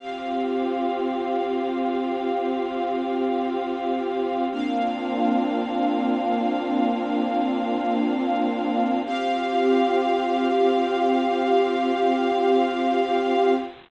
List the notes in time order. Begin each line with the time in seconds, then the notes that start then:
0.00 C4 F4 G4 F5
4.52 A#3 C4 D4 F4 F5
9.06 C4 F4 G4 F5